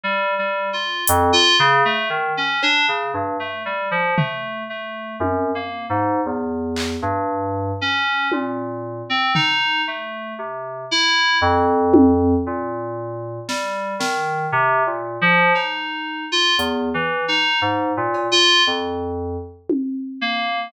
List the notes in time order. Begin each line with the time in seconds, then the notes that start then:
0.04 G3
0.39 G3
0.73 F4
1.08 F2, closed hi-hat
1.33 F4
1.59 C#3
1.85 A3
2.10 D#3
2.37 C#4
2.63 D4, cowbell
2.88 C#3
3.14 G2
3.40 A3
3.66 G3
3.91 F3
4.17 A3, floor tom
4.70 A3
5.20 F#2, high tom
5.55 A#3
5.90 G#2
6.26 E2
6.77 clap
7.02 G2
7.81 C#4
8.32 A#2, high tom
9.10 C4
9.35 D#4, floor tom
9.88 A3
10.39 C3
10.91 E4
11.41 F2
11.94 high tom
12.47 A#2
13.48 G3, snare
13.99 D#3, snare
14.52 C3
14.86 A#2
15.22 F3
15.55 D#4, cowbell
16.32 F4
16.58 E2, closed hi-hat
16.94 E3
17.28 D#4
17.62 G#2
17.97 A#2
18.14 cowbell
18.32 F4
18.67 F2
19.70 high tom
20.21 A#3